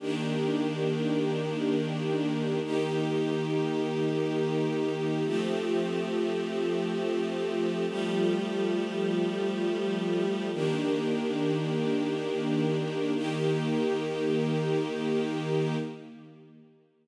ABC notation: X:1
M:5/4
L:1/8
Q:1/4=57
K:Eblyd
V:1 name="String Ensemble 1"
[E,B,DG]5 [E,B,EG]5 | [F,A,CG]5 [F,G,A,G]5 | [E,B,DG]5 [E,B,EG]5 |]